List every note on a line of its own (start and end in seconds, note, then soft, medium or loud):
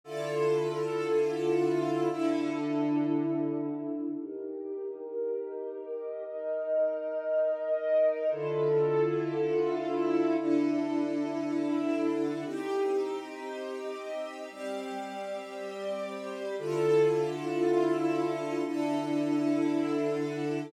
0.04 2.09 D3 loud
0.04 2.09 E4 medium
0.04 2.09 F4 loud
0.04 2.09 A4 loud
2.11 4.16 D3 loud
2.11 4.16 D4 medium
2.11 4.16 E4 medium
2.11 4.16 A4 loud
4.19 6.23 D#4 loud
4.19 6.23 G4 medium
4.19 6.23 A#4 loud
6.26 8.30 D#4 loud
6.26 8.30 A#4 medium
6.26 8.30 D#5 loud
8.31 10.36 D3 loud
8.31 10.36 E4 loud
8.31 10.36 F4 medium
8.31 10.36 A4 loud
10.39 12.44 D3 medium
10.39 12.44 D4 loud
10.39 12.44 E4 loud
10.39 12.44 A4 medium
12.45 14.50 C4 medium
12.45 14.50 D#4 loud
12.45 14.50 G4 loud
14.50 16.55 G3 medium
14.50 16.55 C4 medium
14.50 16.55 G4 loud
16.59 18.63 D3 loud
16.59 18.63 E4 medium
16.59 18.63 F4 loud
16.59 18.63 A4 loud
18.66 20.70 D3 loud
18.66 20.70 D4 medium
18.66 20.70 E4 medium
18.66 20.70 A4 loud